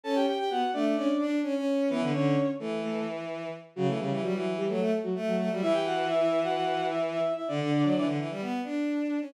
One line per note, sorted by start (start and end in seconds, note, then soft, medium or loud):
0.03 0.25 C#4 medium
0.03 0.15 A4 medium
0.03 0.15 A5 medium
0.15 0.26 G4 medium
0.15 0.26 G5 medium
0.27 0.38 G4 medium
0.27 0.38 G5 medium
0.38 0.50 G4 medium
0.38 0.50 G5 medium
0.50 0.61 B3 medium
0.50 0.71 F#4 medium
0.50 0.71 F#5 medium
0.73 0.94 A3 medium
0.73 0.84 D4 medium
0.73 0.84 D5 medium
0.85 0.96 D4 medium
0.85 0.96 D5 medium
0.96 1.07 C#4 medium
0.96 1.25 D4 medium
0.96 1.25 D5 medium
1.19 1.40 D4 medium
1.43 1.54 C#4 medium
1.55 1.89 C#4 medium
1.90 2.01 E3 medium
1.90 2.10 B3 medium
1.90 2.10 B4 medium
2.01 2.12 D3 medium
2.13 2.35 D3 medium
2.13 2.50 C#4 medium
2.13 2.50 C#5 medium
2.59 3.49 E3 medium
2.59 2.81 A3 medium
2.59 2.81 A4 medium
2.82 3.04 A3 medium
2.82 3.04 A4 medium
3.76 3.87 C#3 medium
3.76 3.87 F#3 medium
3.76 3.87 F#4 medium
3.87 3.98 E3 medium
3.87 3.98 A3 medium
3.87 3.98 A4 medium
3.99 4.10 C#3 medium
3.99 4.21 G3 medium
3.99 4.21 G4 medium
4.10 4.22 E3 medium
4.22 4.33 F#3 medium
4.22 4.33 G3 medium
4.22 4.33 F#4 medium
4.34 4.65 E3 medium
4.34 4.53 F#3 medium
4.34 4.53 F#4 medium
4.57 4.68 G3 medium
4.57 4.68 G4 medium
4.68 4.79 F#3 medium
4.68 4.99 A3 medium
4.68 4.99 A4 medium
4.80 4.91 A3 medium
5.03 5.15 F#3 medium
5.03 5.15 F#4 medium
5.15 5.36 A3 medium
5.27 5.49 F#3 medium
5.27 5.49 F#4 medium
5.38 5.49 A3 medium
5.50 5.61 F#3 medium
5.50 5.61 G3 medium
5.50 5.61 F#4 medium
5.62 7.19 E3 medium
5.62 5.73 E4 medium
5.62 5.73 E5 loud
5.73 5.84 G4 medium
5.73 5.84 G5 medium
5.85 6.07 F#4 medium
5.85 6.07 F#5 medium
6.08 6.19 E4 medium
6.08 6.19 E5 medium
6.20 6.40 E4 medium
6.20 6.40 E5 medium
6.43 6.54 F#4 medium
6.43 6.54 F#5 medium
6.55 6.86 F#4 medium
6.55 6.86 F#5 medium
6.90 7.01 E4 medium
6.90 7.01 E5 medium
7.13 7.32 E4 medium
7.13 7.32 E5 medium
7.36 7.47 E4 medium
7.36 7.47 E5 medium
7.48 7.59 D3 medium
7.48 8.06 D4 medium
7.48 8.06 D5 medium
7.60 7.70 D3 medium
7.71 7.82 D3 medium
7.83 7.94 F#3 medium
7.95 8.06 E3 medium
8.06 8.17 D3 medium
8.18 8.29 E3 medium
8.30 8.41 G3 medium
8.41 8.60 B3 medium
8.64 9.20 D4 medium
9.22 9.33 C#4 medium